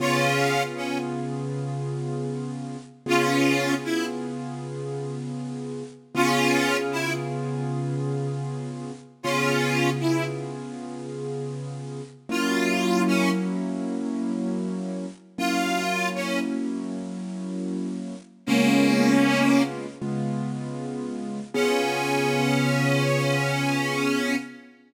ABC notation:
X:1
M:12/8
L:1/8
Q:3/8=78
K:Db
V:1 name="Harmonica"
[DF]3 D z8 | [DF]3 =E z8 | [DF]3 =E z8 | [DF]3 =E z8 |
F3 D z8 | F3 D z8 | [B,D]5 z7 | D12 |]
V:2 name="Acoustic Grand Piano"
[D,_CFA]12 | [D,_CFA]12 | [D,_CFA]12 | [D,_CFA]12 |
[G,B,D_F]12 | [G,B,D_F]12 | [D,A,_CF]6 [D,A,CF]6 | [D,_CFA]12 |]